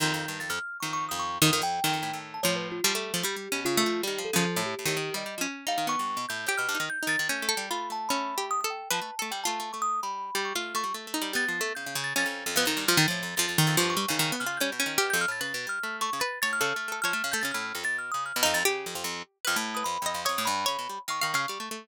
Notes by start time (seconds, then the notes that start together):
0.00 F2 D#3 G6
0.14 F2
0.20 G6
0.28 G2
0.40 F2 A6
0.50 F2 F6
0.80 F2 D#3 C#6
0.93 C#6
1.09 F2 D#6
1.19 C#6
1.42 F2 D#3 D#6
1.53 D#3
1.62 F2 G5
1.84 F2 D#3
1.93 F2
2.03 A2
2.13 A2
2.34 A5
2.43 A2 F3 C#5
2.56 B4
2.72 F4
2.84 F3 G3
2.95 A3
3.14 F3 A3
3.23 G3 G4
3.36 G3
3.52 B2 C#4
3.65 C#3 F4
3.77 A3
3.86 F3
4.03 D#3 G3
4.07 G4
4.18 F3
4.25 A4
4.33 C#3 F3
4.56 A2
4.66 G4
4.79 A2
4.85 A2 D#3 G4
4.97 D#3
5.14 G3 D#5
5.26 G3
5.38 F3 C#4
5.67 G3 D#4 F5
5.78 D#3
5.87 B3 C#6
5.99 G2
6.17 B2
6.29 A2 G6
6.46 A2 G4 G6
6.58 B2 F6
6.69 G2
6.75 D#4
6.80 D#3
6.90 G6
7.03 D#4
7.07 D#3 A6
7.19 D#3
7.29 A3 C#4 G6
7.42 A3
7.49 A4
7.57 G3
7.71 A3 F4 B5
7.90 A3 A5
8.09 A3 C#4 B5
8.38 G4
8.51 D#6
8.61 A4 D#6
8.70 G5
8.91 F3 B4 A5
9.02 A3
9.19 A3 A4
9.31 G3 G5
9.44 A3 F4 A5
9.60 A3
9.73 A3 C#6
9.82 D#6
10.03 G3 B5
10.35 G3
10.45 C#6
10.55 A3 F4 F6
10.75 A3 C#6
10.84 G3
10.94 A3
11.07 A3
11.14 D#4
11.22 G3
11.33 G3 B3 A6
11.48 F3
11.61 A3
11.75 C#3 G6
11.86 C#3
11.95 C#3
12.04 A6
12.16 F2 C#4 A6
12.26 F2 A6
12.46 F2
12.56 F2 B3
12.65 F2 D#3
12.77 G2
12.88 F3 F6
12.97 F2 D#3 A6
13.08 A2 F3
13.23 F2
13.36 F2 F3 A6
13.48 F2 A6
13.58 D#3 A6
13.67 F2 A6
13.77 G2 F3 C#6
13.90 C#6
13.97 G3
14.08 C#3 D#3
14.19 D#3
14.32 B3
14.40 C#3 F6
14.46 F4
14.57 G3 C#4 G6
14.72 B2
14.80 C#4
14.86 D#3
14.98 B2 G4 F6
15.10 F2 G6
15.21 F6
15.28 A2 A6
15.41 C#3 B4 A6
15.54 B2
15.67 G3 F6
15.83 A3
16.01 A3 C#6
16.13 C#3
16.20 B4 A6
16.42 A2 C#5 A6
16.53 F6
16.61 C#3 A4
16.76 A3
16.88 A3 A4
17.02 F3 C#5 F6
17.13 A3
17.24 C#3
17.32 A3 A4 G6
17.41 C#3 C#4 A6
17.51 A2 F6
17.75 F2
17.84 B2 A6
17.98 F6
18.12 C#3 D#6
18.26 F6
18.36 B2
18.43 F2 D#4
18.54 F2 A6
18.65 C#3 G4
18.86 F2
18.95 F2
19.04 F2
19.45 F2 B4 F6
19.56 A2
19.75 B4 D#6
19.84 F2 B5
20.02 F2
20.06 D#5
20.14 F2
20.25 F2 C#5 D#6
20.38 A2
20.45 G2 B5
20.66 C#3 C#5
20.79 B2
20.89 G3
21.08 D#3 F5 C#6
21.21 D#3 F5
21.34 C#3 F5
21.48 G3 F5
21.60 A3
21.71 A3